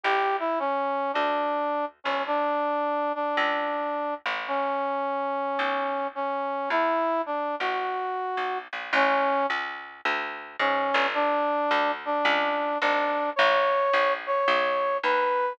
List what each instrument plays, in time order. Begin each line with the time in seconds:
0.03 electric bass (finger) A1, brass section G4
0.39 brass section E4
0.59 brass section C#4
1.13 electric bass (finger) D2, brass section D4
2.04 electric bass (finger) G1, brass section C#4
2.27 brass section D4
3.15 brass section D4
3.37 electric bass (finger) C#2
4.26 electric bass (finger) A1
4.48 brass section C#4
5.59 electric bass (finger) B1
6.15 brass section C#4
6.70 electric bass (finger) E2, brass section E4
7.26 brass section D4
7.59 electric bass (finger) A1, brass section F#4
8.37 electric bass (finger) B1
8.73 electric bass (finger) A#1
8.93 electric bass (finger) A1, brass section C#4
9.50 electric bass (finger) C#2
10.05 electric bass (finger) D2
10.59 electric bass (finger) G#2, brass section C#4
10.94 electric bass (finger) G1
11.14 brass section D4
11.71 electric bass (finger) D2
12.05 brass section D4
12.25 electric bass (finger) C#2
12.81 electric bass (finger) G#1, brass section D4
13.36 electric bass (finger) A1, brass section C#5
13.93 electric bass (finger) A#1
14.27 brass section C#5
14.48 electric bass (finger) B1
15.03 electric bass (finger) D#2, brass section B4